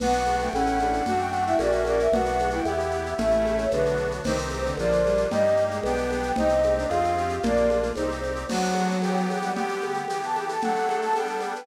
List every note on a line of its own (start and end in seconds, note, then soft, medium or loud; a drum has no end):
0.00 0.49 B1 medium
0.00 0.12 B3 medium
0.00 0.49 B3 loud
0.00 0.49 D4 loud
0.00 0.49 F#4 loud
0.00 0.36 F#5 loud
0.00 crash medium
0.00 low conga loud
0.00 shaker medium
0.12 shaker medium
0.25 high conga medium
0.25 shaker medium
0.39 0.51 A3 medium
0.39 0.54 G5 loud
0.39 shaker medium
0.53 1.02 A1 medium
0.53 1.02 A3 medium
0.53 0.78 C#4 medium
0.53 1.02 C#4 medium
0.53 1.02 E4 medium
0.53 1.05 F#5 loud
0.53 high conga medium
0.53 shaker medium
0.66 shaker medium
0.79 1.04 D4 medium
0.79 high conga medium
0.79 shaker medium
0.93 shaker medium
1.06 1.55 F#2 medium
1.06 1.55 A3 loud
1.06 1.55 D4 loud
1.06 1.19 F#4 medium
1.06 1.55 F#4 medium
1.06 1.17 F#5 loud
1.06 low conga loud
1.06 shaker medium
1.19 1.30 G5 loud
1.19 shaker medium
1.32 1.45 F#5 loud
1.32 shaker medium
1.46 1.58 E4 medium
1.46 1.57 E5 loud
1.46 shaker medium
1.59 2.08 A#1 medium
1.59 2.07 A#3 loud
1.59 2.07 C#4 loud
1.59 2.07 F#4 medium
1.59 1.83 F#4 medium
1.59 1.72 D5 loud
1.59 high conga medium
1.59 shaker medium
1.71 1.83 E5 medium
1.71 shaker medium
1.85 2.09 A#4 medium
1.85 1.97 D5 loud
1.85 high conga medium
1.85 shaker medium
1.99 2.14 E5 loud
1.99 shaker medium
2.12 2.61 B1 medium
2.12 2.61 B3 medium
2.12 2.61 D4 medium
2.12 2.25 F#4 medium
2.12 2.61 F#4 medium
2.12 2.50 F#5 loud
2.12 low conga loud
2.12 shaker medium
2.25 shaker medium
2.39 high conga medium
2.39 shaker medium
2.50 2.65 E4 medium
2.50 2.66 G5 loud
2.50 shaker medium
2.65 3.14 E2 medium
2.65 3.14 B3 medium
2.65 3.14 E4 loud
2.65 2.87 G4 medium
2.65 3.14 G4 medium
2.65 3.09 E5 loud
2.65 high conga medium
2.65 shaker medium
2.79 shaker medium
2.91 3.14 G4 medium
2.91 shaker medium
3.06 shaker medium
3.17 3.68 A1 medium
3.17 3.65 A3 medium
3.17 3.64 A3 medium
3.17 3.65 C#4 medium
3.17 3.65 E4 medium
3.17 3.57 E5 loud
3.17 low conga loud
3.17 shaker medium
3.31 shaker medium
3.45 high conga medium
3.45 shaker medium
3.57 3.68 C#5 loud
3.57 shaker medium
3.71 4.21 B1 medium
3.71 3.97 D3 medium
3.71 4.21 B3 medium
3.71 4.21 D4 medium
3.71 4.21 F#4 medium
3.71 4.11 B4 loud
3.71 high conga medium
3.71 shaker medium
3.86 shaker medium
3.96 high conga medium
3.96 shaker medium
4.11 shaker medium
4.24 4.74 C2 medium
4.24 4.36 D#3 medium
4.24 4.73 C4 loud
4.24 4.73 D#4 loud
4.24 4.73 G4 loud
4.24 4.61 C5 loud
4.24 crash medium
4.24 low conga loud
4.24 shaker medium
4.38 shaker medium
4.50 high conga medium
4.50 shaker medium
4.65 4.76 D3 medium
4.65 shaker medium
4.77 5.26 A#1 medium
4.77 5.01 F3 medium
4.77 5.27 A#3 medium
4.77 5.27 D4 medium
4.77 5.27 F4 medium
4.77 5.21 D5 loud
4.77 high conga medium
4.77 shaker medium
4.92 shaker medium
5.04 5.26 G3 medium
5.04 high conga medium
5.04 shaker medium
5.17 shaker medium
5.31 5.80 G2 medium
5.31 5.43 G3 medium
5.31 5.79 A#3 loud
5.31 5.79 D#4 loud
5.31 5.79 G4 medium
5.31 5.63 D#5 loud
5.31 low conga loud
5.31 shaker medium
5.46 shaker medium
5.57 shaker medium
5.71 5.83 G#3 medium
5.71 shaker medium
5.83 6.32 B1 medium
5.83 6.10 B3 medium
5.83 6.32 B3 loud
5.83 6.32 D4 loud
5.83 6.32 G4 medium
5.83 6.29 G5 loud
5.83 high conga medium
5.83 shaker medium
5.97 shaker medium
6.11 6.32 B3 medium
6.11 high conga medium
6.11 shaker medium
6.23 shaker medium
6.36 6.86 C2 medium
6.36 6.86 C4 medium
6.36 6.49 D#4 medium
6.36 6.86 D#4 medium
6.36 6.86 G4 medium
6.36 6.74 D#5 loud
6.36 low conga loud
6.36 shaker medium
6.49 shaker medium
6.63 high conga medium
6.63 shaker medium
6.77 6.88 D4 medium
6.77 shaker medium
6.89 7.39 F2 medium
6.89 7.36 C4 medium
6.89 7.36 F4 loud
6.89 7.12 F4 medium
6.89 7.36 G#4 medium
6.89 7.33 F5 loud
6.89 high conga medium
6.89 shaker medium
7.04 shaker medium
7.17 7.40 G4 medium
7.17 shaker medium
7.29 shaker medium
7.43 7.92 A#1 medium
7.43 7.90 A#3 medium
7.43 7.68 A#3 medium
7.43 7.90 D4 medium
7.43 7.90 F4 medium
7.43 7.78 D5 loud
7.43 low conga loud
7.43 shaker medium
7.57 shaker medium
7.70 high conga medium
7.70 shaker medium
7.83 shaker medium
7.96 8.45 C2 medium
7.96 8.44 C4 medium
7.96 8.09 D#4 medium
7.96 8.44 D#4 medium
7.96 8.44 G4 medium
7.96 8.19 C5 loud
7.96 high conga medium
7.96 shaker medium
8.12 shaker medium
8.24 high conga medium
8.24 shaker medium
8.36 shaker medium
8.49 9.26 F#3 medium
8.49 8.97 B3 medium
8.49 8.97 D4 medium
8.49 8.97 F#4 medium
8.49 8.87 F#5 loud
8.49 crash loud
8.49 low conga loud
8.49 shaker medium
8.64 shaker medium
8.74 high conga medium
8.74 shaker medium
8.91 shaker medium
9.02 9.51 E3 medium
9.02 9.51 B3 loud
9.02 9.51 G4 loud
9.02 9.13 G5 loud
9.02 high conga medium
9.02 shaker medium
9.17 9.29 G5 loud
9.17 shaker medium
9.29 9.41 G5 loud
9.29 high conga medium
9.29 shaker medium
9.42 9.55 G3 medium
9.42 9.53 F#5 loud
9.42 shaker medium
9.55 10.03 D3 medium
9.55 10.03 B3 loud
9.55 10.03 G4 medium
9.55 10.24 G4 medium
9.55 9.93 G5 loud
9.55 low conga medium
9.55 shaker medium
9.68 shaker medium
9.81 high conga medium
9.81 shaker medium
9.94 shaker medium
10.08 10.57 E3 loud
10.08 10.57 B3 medium
10.08 10.57 G4 medium
10.08 10.21 G5 medium
10.08 high conga medium
10.08 shaker medium
10.23 10.36 A5 medium
10.23 shaker medium
10.34 10.46 G5 loud
10.34 high conga medium
10.34 shaker medium
10.49 10.60 A4 medium
10.49 10.61 A5 medium
10.49 shaker medium
10.61 11.12 F#3 medium
10.61 11.12 A3 medium
10.61 11.12 D4 medium
10.61 11.28 A4 medium
10.61 10.96 F#5 loud
10.61 low conga medium
10.61 shaker medium
10.76 shaker medium
10.89 high conga medium
10.89 shaker medium
11.02 11.15 A5 loud
11.02 shaker medium
11.13 11.63 G3 medium
11.13 11.63 B3 loud
11.13 11.63 D4 medium
11.13 11.61 G5 loud
11.13 high conga medium
11.13 shaker medium
11.27 shaker medium
11.40 high conga medium
11.40 shaker medium
11.55 11.66 B4 medium
11.55 shaker medium